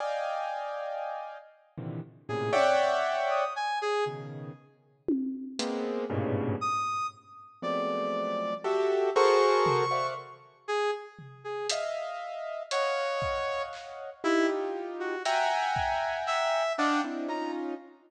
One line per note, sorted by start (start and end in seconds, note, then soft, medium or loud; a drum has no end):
0.00 1.37 D5 medium
0.00 1.37 D#5 medium
0.00 1.37 F5 medium
0.00 1.37 G5 medium
0.00 1.37 G#5 medium
1.78 2.00 A#2 medium
1.78 2.00 C3 medium
1.78 2.00 D3 medium
1.78 2.00 D#3 medium
1.78 2.00 E3 medium
2.29 2.52 A2 medium
2.29 2.52 A#2 medium
2.29 2.52 C3 medium
2.29 2.52 C#3 medium
2.29 2.51 G#4 medium
2.53 3.44 C#5 loud
2.53 3.44 D5 loud
2.53 3.44 E5 loud
2.53 3.44 F#5 loud
2.53 3.44 G5 loud
2.53 high tom medium
3.31 3.53 D#6 medium
3.56 3.79 G#5 medium
3.82 4.04 G#4 loud
4.06 4.52 B2 medium
4.06 4.52 C#3 medium
4.06 4.52 D#3 medium
5.08 high tom loud
5.59 6.05 G#3 medium
5.59 6.05 A#3 medium
5.59 6.05 B3 medium
5.59 6.05 C4 medium
5.59 closed hi-hat medium
6.10 6.56 G2 loud
6.10 6.56 G#2 loud
6.10 6.56 A2 loud
6.10 6.56 A#2 loud
6.10 6.56 B2 loud
6.10 6.56 C#3 loud
6.61 7.07 D#6 loud
7.62 8.54 F3 medium
7.62 8.54 F#3 medium
7.62 8.54 G#3 medium
7.62 8.54 A3 medium
7.62 8.54 B3 medium
7.62 8.54 C4 medium
7.62 8.54 D5 medium
8.64 9.10 F#4 medium
8.64 9.10 G4 medium
8.64 9.10 A4 medium
8.64 9.10 E5 medium
9.15 9.85 F#4 loud
9.15 9.85 G#4 loud
9.15 9.85 A4 loud
9.15 9.85 A#4 loud
9.15 9.85 C5 loud
9.15 10.07 C#6 loud
9.66 floor tom medium
9.91 10.14 C5 medium
9.91 10.14 D5 medium
9.91 10.14 E5 medium
9.91 10.14 F5 medium
9.91 10.14 F#5 medium
10.68 10.91 G#4 loud
11.19 floor tom soft
11.44 11.67 G#4 medium
11.69 12.62 D#5 medium
11.69 12.62 E5 medium
11.69 12.62 F5 medium
11.69 closed hi-hat loud
12.71 13.62 C#5 loud
12.71 14.10 C#5 medium
12.71 14.10 D#5 medium
12.71 14.10 F5 medium
12.71 14.10 F#5 medium
12.71 closed hi-hat medium
13.22 kick medium
13.73 clap medium
14.24 15.15 D#4 medium
14.24 14.47 E4 loud
14.24 15.15 F4 medium
14.24 15.15 G4 medium
15.00 15.23 F#4 medium
15.25 16.63 E5 loud
15.25 16.63 F#5 loud
15.25 16.63 G5 loud
15.25 16.17 G#5 medium
15.25 16.63 G#5 loud
15.25 16.63 A#5 loud
15.25 closed hi-hat medium
15.76 kick medium
16.27 16.73 E5 loud
16.27 clap medium
16.78 17.01 D4 loud
16.78 17.02 D5 medium
16.78 17.02 D#5 medium
16.78 17.02 F5 medium
16.78 17.02 F#5 medium
16.78 17.02 G5 medium
16.78 17.02 A5 medium
17.04 17.27 C4 medium
17.04 17.27 D4 medium
17.04 17.27 D#4 medium
17.04 17.27 E4 medium
17.28 17.74 C#4 medium
17.28 17.74 D#4 medium
17.28 17.74 F4 medium
17.28 17.51 A#5 medium